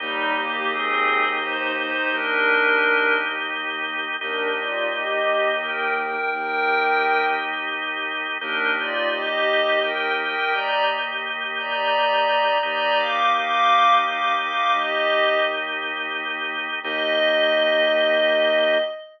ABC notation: X:1
M:6/8
L:1/8
Q:3/8=57
K:Eb
V:1 name="Pad 5 (bowed)"
[G,E] [B,G] [CA]2 [Ec] [Ec] | [DB]3 z3 | [DB] [Fd] [Ge]2 [Bg] [Bg] | [Bg]3 z3 |
[DB] [Fd] [Ge]2 [Bg] [Bg] | [db] z2 [db]3 | [db] [fd'] [fd']2 [fd'] [fd'] | [Ge]2 z4 |
e6 |]
V:2 name="Violin" clef=bass
E,,6 | E,,6 | E,,6 | E,,6 |
E,,6 | E,,6 | E,,6 | E,,6 |
E,,6 |]
V:3 name="Drawbar Organ"
[B,EG]6- | [B,EG]6 | [B,EG]6- | [B,EG]6 |
[B,EG]6- | [B,EG]6 | [B,EG]6- | [B,EG]6 |
[B,EG]6 |]